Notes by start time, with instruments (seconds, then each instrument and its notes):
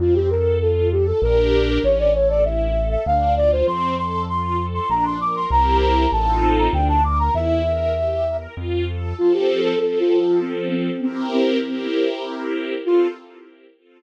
0.00 acoustic grand piano F2, string ensemble 1 C4, flute F4
0.15 flute G4
0.31 string ensemble 1 A4, flute A#4
0.61 string ensemble 1 F4, flute A4
0.92 flute G4, string ensemble 1 A4
1.07 flute A4
1.22 acoustic grand piano A#1, string ensemble 1 D4 G4 A#4, flute A#4
1.68 flute A#4
1.84 acoustic grand piano A1, string ensemble 1 C#4, flute C#5
1.99 flute D5
2.14 string ensemble 1 A4, flute C#5
2.30 flute D5
2.44 string ensemble 1 E4, flute E5
2.76 string ensemble 1 A4
2.91 flute E5
3.06 acoustic grand piano D2, string ensemble 1 D4, flute F5
3.37 string ensemble 1 F4, flute D5
3.52 flute C5
3.67 acoustic grand piano F2, string ensemble 1 C4, flute C6
3.98 string ensemble 1 A4, flute C6
4.29 string ensemble 1 F4, flute C6
4.59 string ensemble 1 A4
4.74 flute C6
4.89 acoustic grand piano A#1, string ensemble 1 D4, flute A#5
5.05 flute C6
5.20 string ensemble 1 A#4, flute D6
5.36 flute C6
5.51 acoustic grand piano C2, string ensemble 1 C4 E4 G4 A#4, flute A#5
5.82 flute A#5
6.12 acoustic grand piano A1, string ensemble 1 C4 D#4 F4 A4, flute A5
6.58 flute A#5
6.73 acoustic grand piano D2, string ensemble 1 D4, flute G5
6.89 flute A5
7.04 string ensemble 1 A#4, flute D6
7.19 flute A#5
7.34 acoustic grand piano E2, string ensemble 1 E4, flute E5
7.65 string ensemble 1 A#4
7.96 string ensemble 1 G4
8.27 string ensemble 1 A#4
8.57 acoustic grand piano F2, string ensemble 1 F4
8.88 string ensemble 1 A4
9.18 string ensemble 1 F3 C4 A4, flute F4
9.34 flute G4
9.64 flute A4
9.80 string ensemble 1 F3 C4 A4, flute A4
10.00 flute F4
10.20 flute F4
10.41 flute C4
10.71 flute C4
11.02 flute C4, string ensemble 1 C4 E4 G4 A#4
11.33 flute C4
11.63 string ensemble 1 C4 E4 G4 A#4
12.86 string ensemble 1 C4 F4 A4, flute F4